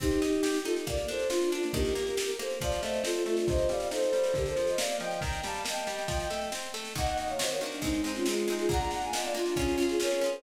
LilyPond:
<<
  \new Staff \with { instrumentName = "Violin" } { \time 4/4 \key c \dorian \tempo 4 = 138 <ees' g'>4. <f' a'>16 r16 <bes' d''>8 <a' c''>8 <d' f'>8 <d' f'>16 <bes d'>16 | <g' bes'>4. <a' c''>16 r16 <d'' f''>8 <c'' ees''>8 <f' a'>8 <f' a'>16 <d' f'>16 | <c'' ees''>8 <d'' f''>8 <a' c''>8. <a' c''>16 <g' bes'>16 <a' c''>8 <c'' ees''>16 <d'' f''>8 <ees'' g''>8 | <g'' bes''>8 <f'' a''>16 <f'' a''>16 <ees'' g''>2 r4 |
\key ees \dorian <ees'' ges''>16 <ees'' ges''>16 <ees'' ges''>16 <des'' f''>16 <c'' ees''>16 <bes' des''>16 d'8 <c' ees'>8. <des' f'>16 <f' aes'>8. <f' aes'>16 | <ges'' bes''>16 <ges'' bes''>16 <ges'' bes''>16 <f'' aes''>16 <ees'' ges''>16 <d'' f''>16 <d' f'>8 <des' f'>8. <f' aes'>16 <bes' des''>8. <aes' c''>16 | }
  \new Staff \with { instrumentName = "Orchestral Harp" } { \time 4/4 \key c \dorian c'8 ees'8 g'8 ees'8 bes8 d'8 f'8 d'8 | ees8 bes8 g'8 bes8 f8 a8 c'8 a8 | c8 g8 ees'8 g8 d8 f8 bes8 f8 | ees8 g8 bes8 g8 f8 a8 c'8 a8 |
\key ees \dorian <ees bes ges'>4 <ees bes ges'>8 <ees bes ges'>8 <aes c' ees'>8 <aes c' ees'>8 <aes c' ees'>8 <aes c' ees'>8 | <bes d' f'>4 <bes d' f'>8 <bes d' f'>8 <des' f' aes'>8 <des' f' aes'>8 <des' f' aes'>8 <des' f' aes'>8 | }
  \new DrumStaff \with { instrumentName = "Drums" } \drummode { \time 4/4 <cymc bd sn>16 sn16 sn16 sn16 sn16 sn16 sn16 sn16 <bd sn>16 sn16 sn16 sn16 sn16 sn16 sn16 sn16 | <bd sn>16 sn16 sn16 sn16 sn16 sn16 sn16 sn16 <bd sn>16 sn16 sn16 sn16 sn16 sn16 sn16 sn16 | <bd sn>16 sn16 sn16 sn16 sn16 sn16 sn16 sn16 <bd sn>16 sn16 sn16 sn16 sn16 sn16 sn16 sn16 | <bd sn>16 sn16 sn16 sn16 sn16 sn16 sn16 sn16 <bd sn>16 sn16 sn16 sn16 sn16 sn16 sn16 sn16 |
<bd sn>16 sn16 sn16 sn16 sn16 sn16 sn16 sn16 <bd sn>16 sn16 sn16 sn16 sn16 sn16 sn16 sn16 | <bd sn>16 sn16 sn16 sn16 sn16 sn16 sn16 sn16 <bd sn>16 sn16 sn16 sn16 sn16 sn16 sn16 sn16 | }
>>